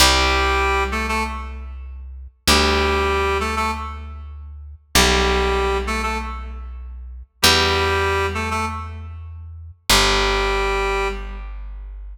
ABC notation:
X:1
M:4/4
L:1/16
Q:1/4=97
K:G
V:1 name="Clarinet"
[G,G]6 [A,A] [A,A] z8 | [G,G]6 [A,A] [A,A] z8 | [G,G]6 [A,A] [A,A] z8 | [G,G]6 [A,A] [A,A] z8 |
[G,G]8 z8 |]
V:2 name="Electric Bass (finger)" clef=bass
C,,16 | D,,16 | B,,,16 | E,,16 |
G,,,16 |]